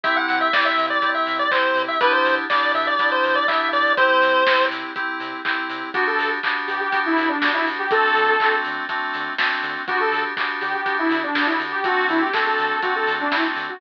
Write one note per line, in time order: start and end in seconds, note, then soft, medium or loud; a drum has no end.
0.03 0.17 C2 medium
0.03 0.48 C4 loud
0.03 0.48 E4 loud
0.03 0.48 G4 medium
0.03 0.15 E5 loud
0.03 kick loud
0.03 closed hi-hat loud
0.17 0.39 F#5 loud
0.28 0.43 C3 medium
0.28 open hi-hat loud
0.41 0.52 E5 loud
0.52 0.66 C2 medium
0.52 0.98 C4 medium
0.52 0.98 E4 medium
0.52 0.98 G4 medium
0.52 0.65 D5 loud
0.52 kick loud
0.52 snare loud
0.65 0.86 E5 loud
0.78 0.91 C3 medium
0.78 open hi-hat medium
0.90 1.10 D5 loud
1.02 1.15 C2 medium
1.02 1.46 C4 medium
1.02 1.46 E4 medium
1.02 1.46 G4 medium
1.02 kick medium
1.02 closed hi-hat loud
1.15 1.37 E5 medium
1.27 1.41 C3 medium
1.27 open hi-hat medium
1.39 1.51 D5 loud
1.51 1.65 C2 medium
1.51 1.96 C4 medium
1.51 1.96 E4 medium
1.51 1.96 G4 medium
1.51 1.82 C5 loud
1.51 kick loud
1.51 clap loud
1.75 1.88 C3 medium
1.75 open hi-hat medium
1.88 2.00 E5 loud
2.01 2.15 B1 medium
2.01 2.45 B3 loud
2.01 2.45 D4 loud
2.01 2.45 E4 medium
2.01 2.45 G4 loud
2.01 2.12 B4 loud
2.01 kick loud
2.01 closed hi-hat loud
2.13 2.35 C5 loud
2.25 2.39 B2 medium
2.25 open hi-hat loud
2.49 2.63 B1 medium
2.49 2.95 B3 medium
2.49 2.95 D4 medium
2.49 2.95 E4 medium
2.49 2.95 G4 medium
2.49 2.72 D5 loud
2.49 kick loud
2.49 snare loud
2.74 2.87 B2 medium
2.74 2.86 E5 loud
2.74 open hi-hat medium
2.87 3.10 D5 loud
2.98 3.12 B1 medium
2.98 3.44 B3 medium
2.98 3.44 D4 medium
2.98 3.44 E4 medium
2.98 3.44 G4 medium
2.98 kick loud
2.98 closed hi-hat loud
3.12 3.35 C5 loud
3.24 3.37 B2 medium
3.24 open hi-hat medium
3.35 3.47 D5 loud
3.48 3.61 B1 medium
3.48 3.92 B3 medium
3.48 3.92 D4 medium
3.48 3.92 E4 medium
3.48 3.92 G4 medium
3.48 3.69 E5 loud
3.48 kick loud
3.48 clap loud
3.73 3.86 B2 medium
3.73 3.93 D5 loud
3.73 open hi-hat medium
3.97 4.11 C2 medium
3.97 4.42 C4 loud
3.97 4.42 E4 medium
3.97 4.42 G4 medium
3.97 4.65 C5 loud
3.97 kick loud
3.97 closed hi-hat loud
4.22 4.35 C3 medium
4.22 open hi-hat loud
4.46 4.60 C2 medium
4.46 4.91 C4 medium
4.46 4.91 E4 medium
4.46 4.91 G4 medium
4.46 kick medium
4.46 snare loud
4.70 4.84 C3 medium
4.70 open hi-hat loud
4.96 5.10 C2 medium
4.96 5.40 C4 medium
4.96 5.40 E4 medium
4.96 5.40 G4 medium
4.96 kick loud
4.96 closed hi-hat loud
5.20 5.34 C3 medium
5.20 open hi-hat medium
5.45 5.59 C2 medium
5.45 5.89 C4 medium
5.45 5.89 E4 medium
5.45 5.89 G4 medium
5.45 kick loud
5.45 clap loud
5.69 5.83 C3 medium
5.69 open hi-hat loud
5.94 6.09 G1 medium
5.94 6.39 B3 medium
5.94 6.39 D4 loud
5.94 6.06 F#4 medium
5.94 6.39 F#4 medium
5.94 6.39 G4 medium
5.94 kick loud
5.94 closed hi-hat loud
6.07 6.30 A4 medium
6.18 6.31 G2 medium
6.18 open hi-hat loud
6.43 6.58 G1 medium
6.43 6.88 B3 medium
6.43 6.88 D4 medium
6.43 6.88 F#4 medium
6.43 6.88 G4 medium
6.43 kick medium
6.43 clap loud
6.67 6.81 G2 medium
6.67 6.79 G4 medium
6.67 open hi-hat medium
6.80 7.00 G4 medium
6.92 7.07 G1 medium
6.92 7.36 B3 medium
6.92 7.36 D4 medium
6.92 7.36 F#4 medium
6.92 7.36 G4 medium
6.92 kick loud
6.92 closed hi-hat loud
7.06 7.28 E4 medium
7.17 7.31 G2 medium
7.17 open hi-hat medium
7.29 7.52 D4 medium
7.41 7.55 G1 medium
7.41 7.86 B3 medium
7.41 7.86 D4 medium
7.41 7.86 F#4 medium
7.41 7.86 G4 medium
7.41 kick medium
7.41 snare loud
7.54 7.65 E4 medium
7.66 8.05 D2 medium
7.66 open hi-hat medium
7.79 7.90 G4 medium
7.91 8.36 A3 medium
7.91 8.36 C4 medium
7.91 8.36 D4 medium
7.91 8.36 F#4 medium
7.91 8.56 A4 medium
7.91 kick loud
7.91 closed hi-hat loud
8.15 8.30 D3 medium
8.15 open hi-hat medium
8.39 8.52 D2 medium
8.39 8.85 A3 medium
8.39 8.85 C4 medium
8.39 8.85 D4 medium
8.39 8.85 F#4 medium
8.39 kick loud
8.39 clap loud
8.65 8.79 D3 medium
8.65 open hi-hat medium
8.88 9.01 D2 medium
8.88 9.33 A3 medium
8.88 9.33 C4 medium
8.88 9.33 D4 medium
8.88 9.33 F#4 medium
8.88 kick loud
8.88 closed hi-hat loud
9.14 9.29 D3 medium
9.14 open hi-hat medium
9.38 9.51 D2 medium
9.38 9.83 A3 medium
9.38 9.83 C4 medium
9.38 9.83 D4 medium
9.38 9.83 F#4 medium
9.38 kick loud
9.38 snare loud
9.63 9.77 D3 medium
9.63 open hi-hat medium
9.87 10.01 D2 medium
9.87 10.33 B3 medium
9.87 10.33 D4 medium
9.87 9.99 F#4 medium
9.87 10.33 F#4 medium
9.87 10.33 G4 medium
9.87 kick loud
9.87 closed hi-hat loud
10.00 10.23 A4 medium
10.12 10.25 D3 medium
10.12 open hi-hat medium
10.37 10.51 D2 medium
10.37 10.81 B3 medium
10.37 10.81 D4 medium
10.37 10.81 F#4 medium
10.37 10.81 G4 medium
10.37 kick loud
10.37 clap loud
10.61 10.75 D3 medium
10.61 10.72 G4 medium
10.61 open hi-hat medium
10.74 10.95 G4 medium
10.85 11.00 D2 medium
10.85 11.30 B3 medium
10.85 11.30 D4 medium
10.85 11.30 F#4 medium
10.85 11.30 G4 medium
10.85 kick loud
10.85 closed hi-hat loud
10.99 11.21 E4 medium
11.10 11.24 D3 medium
11.10 open hi-hat loud
11.23 11.47 D4 medium
11.34 11.48 D2 medium
11.34 11.80 B3 medium
11.34 11.80 D4 medium
11.34 11.80 F#4 medium
11.34 11.80 G4 medium
11.34 kick loud
11.34 snare loud
11.47 11.58 E4 medium
11.60 11.73 D3 medium
11.60 open hi-hat medium
11.72 11.83 G4 medium
11.84 11.98 D2 medium
11.84 12.29 A3 medium
11.84 12.29 C4 medium
11.84 12.29 D4 medium
11.84 12.07 F#4 medium
11.84 12.29 F#4 loud
11.84 kick loud
11.84 closed hi-hat loud
12.09 12.23 D3 medium
12.09 12.21 E4 medium
12.09 open hi-hat medium
12.21 12.33 G4 medium
12.33 12.48 D2 medium
12.33 12.78 A3 medium
12.33 12.78 C4 medium
12.33 12.78 D4 medium
12.33 12.78 F#4 medium
12.33 12.45 A4 medium
12.33 kick loud
12.33 snare loud
12.46 12.81 A4 medium
12.58 12.73 D3 medium
12.58 open hi-hat medium
12.82 12.96 D2 medium
12.82 13.27 A3 medium
12.82 13.27 C4 medium
12.82 13.27 D4 medium
12.82 12.94 F#4 medium
12.82 13.27 F#4 medium
12.82 kick loud
12.82 closed hi-hat loud
12.95 13.15 A4 medium
13.07 13.21 D3 medium
13.07 open hi-hat loud
13.20 13.32 D4 medium
13.32 13.46 D2 medium
13.32 13.76 A3 medium
13.32 13.76 C4 medium
13.32 13.76 D4 medium
13.32 13.43 E4 medium
13.32 13.76 F#4 medium
13.32 kick medium
13.32 snare loud
13.56 13.69 D3 medium
13.56 open hi-hat medium
13.69 13.80 F#4 medium